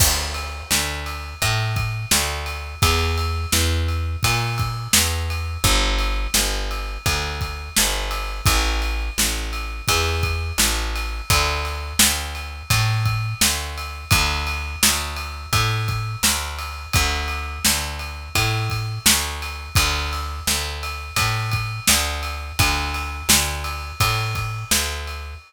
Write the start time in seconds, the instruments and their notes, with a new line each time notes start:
0.00 electric bass (finger) D2, kick, crash
0.34 ride
0.71 electric bass (finger) D2, snare
1.06 ride
1.42 electric bass (finger) A2, kick, ride
1.76 kick, ride
2.11 electric bass (finger) D2, snare
2.46 ride
2.82 electric bass (finger) E2, kick, ride
3.18 ride
3.52 electric bass (finger) E2, snare
3.88 ride
4.23 electric bass (finger) A#2, kick, ride
4.58 kick, ride
4.93 electric bass (finger) E2, snare
5.30 ride
5.64 electric bass (finger) G1, kick, ride
5.99 ride
6.34 electric bass (finger) G1, snare
6.71 ride
7.06 electric bass (finger) D2, kick, ride
7.41 kick, ride
7.76 electric bass (finger) G1, snare
8.11 ride
8.46 electric bass (finger) A1, kick, ride
8.82 ride
9.18 electric bass (finger) A1, snare
9.53 ride
9.88 electric bass (finger) E2, kick, ride
10.23 kick, ride
10.58 electric bass (finger) A1, snare
10.96 ride
11.30 electric bass (finger) D2, kick, ride
11.65 ride
11.99 electric bass (finger) D2, snare
12.35 ride
12.70 electric bass (finger) A2, kick, ride
13.05 kick, ride
13.41 electric bass (finger) D2, snare
13.77 ride
14.11 electric bass (finger) D2, kick, ride
14.47 ride
14.83 electric bass (finger) D2, snare
15.16 ride
15.53 electric bass (finger) A2, kick, ride
15.88 kick, ride
16.23 electric bass (finger) D2, snare
16.59 ride
16.93 electric bass (finger) D2, kick, ride
17.28 ride
17.65 electric bass (finger) D2, snare
17.99 ride
18.35 electric bass (finger) A2, kick, ride
18.70 kick, ride
19.06 electric bass (finger) D2, snare
19.42 ride
19.75 electric bass (finger) D2, kick, ride
20.13 ride
20.47 electric bass (finger) D2, snare
20.83 ride
21.16 electric bass (finger) A2, kick, ride
21.51 kick, ride
21.87 electric bass (finger) D2, snare
22.23 ride
22.59 electric bass (finger) D2, kick, ride
22.94 ride
23.29 electric bass (finger) D2, snare
23.64 ride
24.00 electric bass (finger) A2, kick, ride
24.35 kick, ride
24.71 electric bass (finger) D2, snare
25.07 ride